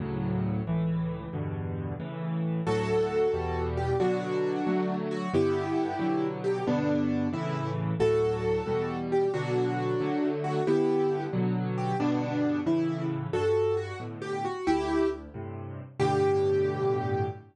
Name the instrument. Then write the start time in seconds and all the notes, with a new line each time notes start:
acoustic grand piano
0.00 D2 A2 C#3 F#3
0.67 C#2 A2 E3
1.33 E2 G2 B2 D3
2.00 A2 C#3 E3
2.67 D2 A2 F#3 F#4 A4
3.34 E2 B2 G3
3.77 G4
4.00 B2 D3 F#3 D4 F#4
4.67 D3 F#3 A3
5.11 F#4
5.34 G2 D3 B3 E4 G4
5.99 B2 D3 F#3
6.44 G4
6.67 G2 B2 D3 B3 D4
7.33 A2 C#3 E3 E4
8.00 D2 A2 F#3 F#4 A4
8.66 E2 B2 G3
9.12 G4
9.34 B2 D3 F#3 D4 F#4
10.01 D3 F#3 A3
10.44 F#4
10.67 G2 D3 B3 E4 G4
11.33 B2 D3 F#3
11.78 G4
12.00 G2 B2 D3 B3 D4
12.66 A2 C#3 E3 E4
13.33 G2 F#4 A4
13.77 F#4
14.00 A2 B2 D3
14.22 G4
14.33 G4
14.45 F#4
14.67 D2 E4 G4
15.34 G2 A2 C3
16.00 G2 A2 B2 D3 G4